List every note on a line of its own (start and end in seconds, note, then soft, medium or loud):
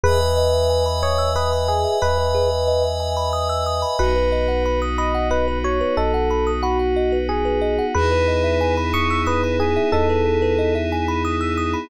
0.04 1.85 E2 loud
0.04 0.19 G#4 loud
0.04 0.84 B4 loud
0.04 3.96 B4 medium
0.04 3.96 D#5 loud
0.04 3.96 E5 medium
0.04 3.96 G#5 medium
0.21 0.36 B4 medium
0.37 0.52 D#5 medium
0.54 0.69 E5 medium
0.70 0.85 G#5 medium
0.86 1.01 B5 medium
1.03 1.30 C#5 medium
1.03 1.18 D#6 medium
1.18 1.33 E6 medium
1.36 1.67 B4 medium
1.36 1.51 D#6 medium
1.53 1.67 B5 medium
1.68 1.98 G#4 medium
1.68 1.84 G#5 medium
1.85 2.00 E5 medium
2.02 3.84 E2 medium
2.02 2.84 B4 medium
2.02 2.16 D#5 medium
2.18 2.33 B4 medium
2.35 2.49 G#4 medium
2.51 2.66 B4 medium
2.68 2.83 D#5 medium
2.84 2.99 E5 medium
3.00 3.15 G#5 medium
3.17 3.32 B5 medium
3.33 3.48 D#6 medium
3.49 3.64 E6 medium
3.66 3.81 D#6 medium
3.82 3.97 B5 medium
3.99 5.81 B1 loud
3.99 7.91 B3 medium
3.99 7.91 D#4 medium
3.99 7.91 F#4 medium
3.99 4.15 F#4 loud
3.99 4.80 B4 medium
4.16 4.30 B4 medium
4.32 4.47 D#5 medium
4.48 4.63 F#5 medium
4.66 4.80 B5 medium
4.82 4.97 D#6 medium
4.98 5.28 D#5 medium
4.98 5.13 B5 medium
5.15 5.29 F#5 medium
5.31 5.59 B4 medium
5.31 5.45 D#5 medium
5.48 5.63 B4 medium
5.64 5.79 F#4 medium
5.64 5.95 C#5 medium
5.81 5.96 B4 medium
5.97 7.79 B1 medium
5.97 6.51 A4 medium
5.97 6.12 D#5 medium
6.14 6.29 F#5 medium
6.31 6.45 B5 medium
6.47 6.62 D#6 medium
6.63 7.18 F#4 medium
6.63 6.78 B5 medium
6.79 6.94 F#5 medium
6.96 7.11 D#5 medium
7.12 7.27 B4 medium
7.29 7.44 F#4 medium
7.29 7.85 G#4 medium
7.45 7.60 B4 medium
7.62 7.76 D#5 medium
7.79 7.94 F#5 medium
7.95 9.77 E2 loud
7.95 11.87 B3 medium
7.95 11.87 D#4 medium
7.95 11.87 E4 loud
7.95 8.10 G#4 medium
7.95 11.87 G#4 loud
7.95 8.75 B4 loud
8.12 8.27 B4 medium
8.28 8.43 D#5 medium
8.44 8.59 E5 medium
8.61 8.76 G#5 medium
8.77 8.92 B5 medium
8.94 9.21 C#6 medium
8.94 9.08 D#6 medium
9.10 9.25 E6 medium
9.27 9.59 B4 medium
9.27 9.41 D#6 medium
9.44 9.59 B5 medium
9.60 9.89 G#4 medium
9.60 9.75 G#5 medium
9.77 9.91 E5 medium
9.92 11.75 E2 medium
9.92 10.74 A4 medium
9.92 10.08 D#5 medium
10.09 10.24 B4 medium
10.26 10.41 G#4 medium
10.42 10.57 B4 medium
10.59 10.73 D#5 medium
10.75 10.90 E5 medium
10.92 11.07 G#5 medium
11.08 11.23 B5 medium
11.25 11.40 D#6 medium
11.41 11.56 E6 medium
11.57 11.72 D#6 medium
11.74 11.88 B5 medium